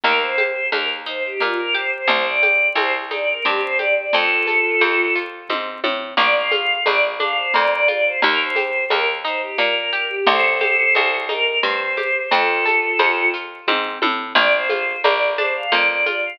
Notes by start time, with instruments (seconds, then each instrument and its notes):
0.04 electric bass (finger) D#2, orchestral harp A#3, choir aahs A#4, cowbell, low conga, shaker
0.21 choir aahs C5
0.38 orchestral harp G4, high conga, shaker
0.72 electric bass (finger) D#2, orchestral harp A#3, choir aahs A#4, cowbell, high conga, shaker
1.06 orchestral harp D#4, choir aahs C5, shaker
1.25 choir aahs G4
1.40 electric bass (finger) A#2, orchestral harp A#3, choir aahs F4, cowbell, low conga, shaker
1.58 choir aahs A#4
1.75 orchestral harp G4, choir aahs C5, shaker
1.93 choir aahs C5
2.08 electric bass (finger) C2, orchestral harp C4, choir aahs C5, cowbell, low conga, shaker
2.25 choir aahs D5
2.43 orchestral harp G4, high conga, shaker
2.75 electric bass (finger) C2, orchestral harp C4, choir aahs C5, cowbell, high conga, shaker
3.11 orchestral harp D#4, choir aahs D5, high conga, shaker
3.28 choir aahs A#4
3.45 electric bass (finger) G2, orchestral harp C4, choir aahs G4, cowbell, low conga, shaker
3.62 choir aahs C5
3.79 orchestral harp G4, choir aahs D5, high conga, shaker
3.97 choir aahs D5
4.13 electric bass (finger) F2, orchestral harp C4, choir aahs F4 A4, cowbell, low conga, shaker
4.47 orchestral harp A4, high conga, shaker
4.81 electric bass (finger) F2, orchestral harp C4, cowbell, high conga, shaker
5.15 orchestral harp F4, shaker
5.49 electric bass (finger) G#2, orchestral harp C4, kick, high tom
5.84 electric bass (finger) A2, orchestral harp A4, high tom
6.17 electric bass (finger) A#1, orchestral harp A#3, choir aahs D5, cowbell, low conga, shaker
6.34 choir aahs F5
6.51 orchestral harp F4, high conga, shaker
6.86 electric bass (finger) A#1, orchestral harp A#3, choir aahs D5, cowbell, high conga, shaker
7.20 orchestral harp D4, choir aahs F5, high conga, shaker
7.37 choir aahs C5
7.54 electric bass (finger) F2, orchestral harp A#3, choir aahs D5, cowbell, low conga, shaker
7.71 choir aahs D5
7.88 orchestral harp F4, choir aahs D5, high conga, shaker
8.05 choir aahs C5
8.22 electric bass (finger) D#2, orchestral harp A#3, choir aahs A#4, cowbell, low conga, shaker
8.40 choir aahs C5
8.56 orchestral harp G4, high conga, shaker
8.90 electric bass (finger) D#2, orchestral harp A#3, choir aahs A#4, cowbell, high conga, shaker
9.25 orchestral harp D#4, choir aahs C5, shaker
9.41 choir aahs G4
9.58 electric bass (finger) A#2, orchestral harp A#3, choir aahs A#4, cowbell, low conga, shaker
9.75 choir aahs A#4
9.91 orchestral harp G4, choir aahs A#4, shaker
10.10 choir aahs G4
10.26 electric bass (finger) C2, orchestral harp C4, choir aahs A4 C5, cowbell, low conga, shaker
10.61 orchestral harp G4, high conga, shaker
10.95 electric bass (finger) C2, orchestral harp C4, cowbell, high conga, shaker
11.29 orchestral harp D#4, choir aahs A#4, high conga, shaker
11.63 electric bass (finger) G2, orchestral harp C4, choir aahs C5, cowbell, low conga, shaker
11.97 orchestral harp G4, high conga, shaker
12.31 electric bass (finger) F2, orchestral harp C4, choir aahs F4 A4, cowbell, low conga, shaker
12.65 orchestral harp A4, high conga, shaker
12.99 electric bass (finger) F2, orchestral harp C4, cowbell, high conga, shaker
13.34 orchestral harp F4, shaker
13.67 electric bass (finger) G#2, orchestral harp C4, kick, high tom
14.02 electric bass (finger) A2, orchestral harp A4, high tom
14.35 electric bass (finger) A#1, orchestral harp A#3, choir aahs D5, cowbell, low conga, shaker
14.52 choir aahs C5
14.69 orchestral harp F4, high conga, shaker
15.04 electric bass (finger) A#1, orchestral harp A#3, choir aahs D5, cowbell, high conga, shaker
15.38 orchestral harp D4, choir aahs C5, high conga, shaker
15.56 choir aahs F5
15.71 electric bass (finger) F2, orchestral harp A#3, choir aahs D5, cowbell, low conga, shaker
15.88 choir aahs D5
16.05 orchestral harp F4, choir aahs D5, high conga, shaker
16.25 choir aahs F5